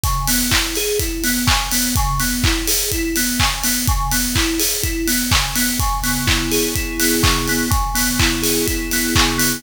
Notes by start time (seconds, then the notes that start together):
0.04 C#3, kick, closed hi-hat
0.27 B3, open hi-hat
0.51 E4, kick, clap
0.75 G#4, open hi-hat
0.99 E4, kick, closed hi-hat
1.24 B3, open hi-hat
1.47 C#3, kick, clap
1.72 B3, open hi-hat
1.95 C#3, kick, closed hi-hat
2.20 B3, open hi-hat
2.44 E4, kick, clap
2.67 G#4, open hi-hat
2.92 E4, kick, closed hi-hat
3.16 B3, open hi-hat
3.40 C#3, kick, clap
3.64 B3, open hi-hat
3.87 C#3, kick, closed hi-hat
4.11 B3, open hi-hat
4.35 E4, kick, clap
4.59 G#4, open hi-hat
4.83 E4, kick, closed hi-hat
5.07 B3, open hi-hat
5.31 C#3, kick, clap
5.55 B3, open hi-hat
5.79 C#3, kick, closed hi-hat
6.03 B3, open hi-hat
6.27 E4, kick, clap
6.51 G#4, open hi-hat
6.75 E4, kick, closed hi-hat
7.00 B3, open hi-hat
7.23 C#3, kick, clap
7.48 B3, open hi-hat
7.71 C#3, kick, closed hi-hat
7.95 B3, open hi-hat
8.20 E4, kick, clap
8.42 G#4, open hi-hat
8.67 E4, kick, closed hi-hat
8.91 B3, open hi-hat
9.15 C#3, kick, clap
9.38 B3, open hi-hat